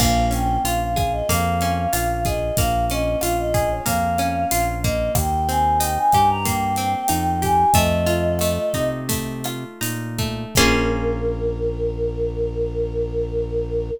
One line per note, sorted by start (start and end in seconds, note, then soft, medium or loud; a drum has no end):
0.00 0.58 A#1 loud
0.00 1.29 A#3 medium
0.00 0.26 F5 medium
0.00 kick loud
0.00 cross-stick loud
0.00 crash loud
0.31 1.61 C#4 medium
0.31 0.59 G5 medium
0.31 closed hi-hat medium
0.64 1.22 A#1 medium
0.64 1.92 F4 medium
0.64 0.80 F5 medium
0.64 closed hi-hat loud
0.81 1.12 F5 medium
0.96 2.25 G#4 medium
0.96 kick loud
0.96 cross-stick loud
0.96 closed hi-hat medium
1.12 1.28 D#5 medium
1.29 1.87 F2 loud
1.29 2.57 A#3 medium
1.29 2.24 F5 medium
1.29 kick medium
1.29 closed hi-hat loud
1.61 2.90 C#4 medium
1.61 closed hi-hat medium
1.93 2.51 A#1 medium
1.93 3.22 F4 medium
1.93 cross-stick loud
1.93 closed hi-hat loud
2.25 3.54 G#4 medium
2.25 2.56 D#5 medium
2.25 kick loud
2.25 closed hi-hat medium
2.57 3.16 A#1 loud
2.57 3.85 A#3 medium
2.57 2.86 F5 medium
2.57 kick loud
2.57 closed hi-hat loud
2.90 4.19 C#4 medium
2.90 3.19 D#5 medium
2.90 closed hi-hat medium
3.21 3.80 A#1 medium
3.21 4.51 F4 medium
3.21 3.37 F5 medium
3.21 cross-stick loud
3.21 closed hi-hat loud
3.39 3.69 D#5 medium
3.54 5.07 G#4 medium
3.54 kick loud
3.54 closed hi-hat medium
3.72 3.87 C#5 medium
3.86 4.45 F2 medium
3.86 4.84 A#3 medium
3.86 4.69 F5 medium
3.86 kick medium
3.86 closed hi-hat loud
4.18 5.11 C#4 medium
4.18 cross-stick medium
4.18 closed hi-hat medium
4.51 5.10 A#1 medium
4.51 5.13 F4 medium
4.51 closed hi-hat loud
4.83 6.45 A#3 medium
4.83 5.12 D#5 medium
4.83 kick loud
4.83 closed hi-hat medium
5.15 5.98 D#2 loud
5.15 5.45 G5 medium
5.15 kick loud
5.15 cross-stick loud
5.15 closed hi-hat loud
5.49 6.77 C4 medium
5.49 5.78 G#5 medium
5.49 closed hi-hat medium
5.79 7.08 D#4 medium
5.79 5.94 G5 medium
5.79 closed hi-hat loud
5.97 6.28 G#5 medium
6.12 6.95 G2 medium
6.12 7.42 G4 medium
6.12 kick medium
6.12 cross-stick medium
6.12 closed hi-hat medium
6.30 6.45 A#5 medium
6.45 7.68 A#3 medium
6.45 7.38 G5 medium
6.45 kick medium
6.45 closed hi-hat loud
6.76 7.69 C4 medium
6.76 closed hi-hat medium
7.08 7.65 F2 loud
7.08 7.70 D#4 medium
7.08 cross-stick loud
7.08 closed hi-hat loud
7.42 7.73 G4 medium
7.42 7.75 G#5 medium
7.42 kick medium
7.42 closed hi-hat medium
7.73 8.59 F2 loud
7.73 8.40 A3 medium
7.73 8.90 D#5 medium
7.73 kick loud
7.73 closed hi-hat loud
8.06 9.44 F4 medium
8.06 closed hi-hat medium
8.39 9.08 A3 medium
8.39 cross-stick medium
8.39 closed hi-hat loud
8.74 9.65 C3 medium
8.74 9.81 D#4 medium
8.74 kick medium
8.74 closed hi-hat medium
9.09 10.18 A3 medium
9.09 kick medium
9.09 closed hi-hat loud
9.44 10.51 F4 medium
9.44 cross-stick loud
9.44 closed hi-hat medium
9.81 10.45 A#2 medium
9.81 10.53 D#4 medium
9.81 closed hi-hat loud
10.19 10.55 A3 medium
10.19 kick medium
10.19 closed hi-hat medium
10.55 13.91 A#1 loud
10.55 13.91 A#3 loud
10.55 13.91 C#4 loud
10.55 13.91 F4 loud
10.55 13.91 G#4 medium
10.55 13.90 A#4 loud
10.55 kick loud
10.55 crash loud